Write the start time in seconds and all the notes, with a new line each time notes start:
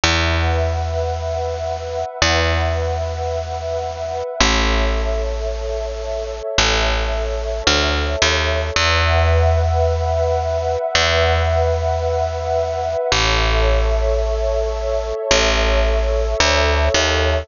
0.04 E2 B4 E5 F#5
2.22 E2
4.40 A1 A4 C#5 E5
6.58 A1
7.67 D2
8.22 D#2
8.76 E2 B4 E5 F#5
10.95 E2
13.11 A1 A4 C#5 E5
15.31 A1
16.40 D2
16.94 D#2